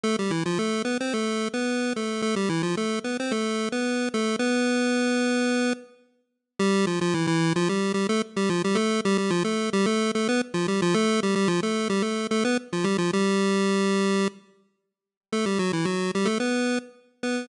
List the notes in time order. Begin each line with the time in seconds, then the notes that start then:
0.03 A3 A4
0.19 G3 G4
0.31 E3 E4
0.46 F3 F4
0.59 A3 A4
0.85 B3 B4
1.00 C4 C5
1.13 A3 A4
1.54 B3 B4
1.96 A3 A4
2.22 A3 A4
2.36 G3 G4
2.49 E3 E4
2.63 F3 F4
2.77 A3 A4
3.04 B3 B4
3.20 C4 C5
3.31 A3 A4
3.72 B3 B4
4.14 A3 A4
4.39 B3 B4
6.59 G3 G4
6.87 F3 F4
7.01 F3 F4
7.14 E3 E4
7.27 E3 E4
7.56 F3 F4
7.69 G3 G4
7.94 G3 G4
8.09 A3 A4
8.36 G3 G4
8.49 F3 F4
8.64 G3 G4
8.75 A3 A4
9.05 G3 G4
9.18 G3 G4
9.30 F3 F4
9.44 A3 A4
9.73 G3 G4
9.86 A3 A4
10.15 A3 A4
10.29 B3 B4
10.54 F3 F4
10.68 G3 G4
10.82 F3 F4
10.94 A3 A4
11.23 G3 G4
11.35 G3 G4
11.48 F3 F4
11.63 A3 A4
11.89 G3 G4
12.02 A3 A4
12.31 A3 A4
12.45 B3 B4
12.73 F3 F4
12.84 G3 G4
12.98 F3 F4
13.13 G3 G4
15.32 A3 A4
15.46 G3 G4
15.59 F#3 F#4
15.73 E3 E4
15.85 F#3 F#4
16.15 G3 G4
16.25 A3 A4
16.40 B3 B4
17.23 B3 B4